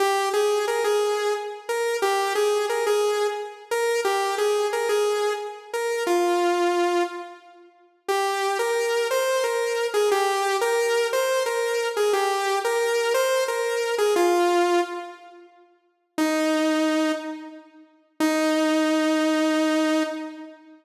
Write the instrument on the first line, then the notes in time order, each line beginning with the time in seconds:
lead 2 (sawtooth)
0.00 G4
0.33 G#4
0.68 A#4
0.84 G#4
1.69 A#4
2.02 G4
2.35 G#4
2.69 A#4
2.87 G#4
3.71 A#4
4.05 G4
4.38 G#4
4.73 A#4
4.89 G#4
5.73 A#4
6.07 F4
8.08 G4
8.59 A#4
9.11 C5
9.44 A#4
9.94 G#4
10.11 G4
10.61 A#4
11.13 C5
11.46 A#4
11.97 G#4
12.13 G4
12.64 A#4
13.14 C5
13.48 A#4
13.98 G#4
14.16 F4
16.18 D#4
18.20 D#4